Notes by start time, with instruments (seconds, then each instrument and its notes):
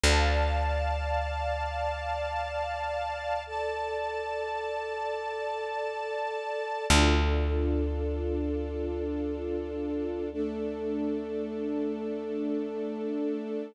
0.03 electric bass (finger) D2, string ensemble 1 D5 F5 A5
3.47 string ensemble 1 A4 D5 A5
6.90 electric bass (finger) D2, string ensemble 1 D4 F4 A4
10.32 string ensemble 1 A3 D4 A4